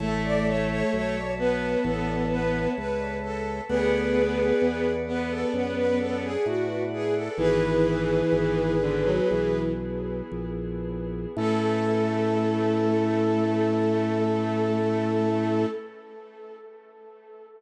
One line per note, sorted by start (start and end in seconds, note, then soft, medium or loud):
0.00 0.83 A1 medium
0.00 1.16 A3 loud
0.00 0.22 A4 medium
0.00 3.61 C#5 medium
0.00 3.61 E5 medium
0.00 3.61 A5 medium
0.24 0.46 D5 medium
0.46 0.68 C#5 medium
0.69 0.91 C#5 medium
0.93 1.76 B1 medium
0.93 1.32 C#5 medium
1.39 2.73 B3 loud
1.39 1.80 B4 medium
1.84 2.68 A1 medium
1.84 2.25 A4 medium
2.31 2.68 B4 medium
2.77 3.61 C#2 medium
2.77 3.17 B4 medium
3.23 3.61 A4 medium
3.69 4.53 D2 medium
3.69 4.87 B3 loud
3.69 4.93 G#4 medium
3.69 4.93 B4 medium
3.69 7.31 B4 medium
3.69 7.31 D5 medium
3.69 7.31 F#5 medium
4.62 5.45 E2 medium
5.08 6.25 B3 loud
5.08 5.30 B4 medium
5.30 5.52 A4 medium
5.53 6.37 F#2 medium
5.53 5.75 B4 medium
5.77 5.98 B4 medium
6.00 6.22 A4 medium
6.23 6.45 G#4 medium
6.45 7.29 A2 medium
6.45 6.83 F#4 medium
6.93 7.15 G#4 medium
7.15 7.37 A4 medium
7.37 8.23 G#1 medium
7.37 8.75 E3 loud
7.37 11.29 B3 medium
7.37 11.29 E4 medium
7.37 9.60 G#4 medium
7.37 11.29 G#4 medium
7.37 9.60 B4 medium
8.32 9.20 G#1 medium
8.81 9.04 D3 loud
9.05 9.29 F#3 loud
9.30 10.22 B1 medium
9.30 9.72 E3 medium
10.31 11.26 A#1 medium
11.37 15.66 A2 loud
11.37 15.67 A3 loud
11.37 15.67 C#4 loud
11.37 15.67 E4 medium
11.37 15.66 A4 loud
11.37 15.67 A4 medium